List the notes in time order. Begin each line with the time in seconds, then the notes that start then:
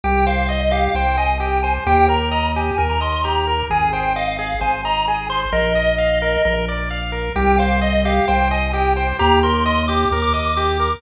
0.04 C2 G4 G5
0.27 C5 F5
0.49 D#5
0.61 D#5
0.71 G4 F5
0.95 C2 C5 G5
1.17 D#5 G#5
1.40 G4 G5
1.63 C5 G#5
1.87 D#2 G4 G5
2.09 A#4 A#5
2.31 D#5
2.56 G4 G#5
2.78 D#2 A#4
2.90 A#5
3.01 D#5 C6
3.12 C6
3.24 G4 A#5
3.47 A#4
3.70 G#1 G#4 G#5
3.93 C5 G5
4.16 D#5 F5
4.28 F5
4.38 G#4 F5
4.61 G#1 C5 G#5
4.85 D#5 A#5
5.08 G#4 G#5
5.30 C5 C6
5.52 A#1 A#4 D#5
5.75 D#5
5.98 F5
6.22 A#4
6.45 A#1 A#4
6.69 D5
6.91 F5
7.12 A#4
7.36 C2 G4 G5
7.58 C5 F5
7.81 D#5
7.93 D#5
8.05 G4 F5
8.28 C2 C5 G5
8.51 D#5 G#5
8.73 G4 G5
8.96 C5 G5
9.19 D#2 G4 A#5
9.43 A#4 C6
9.66 D#5
9.88 G4 D6
10.11 D#2 A#4
10.22 D6
10.33 D#5 D6
10.45 D6
10.56 G4 D6
10.80 A#4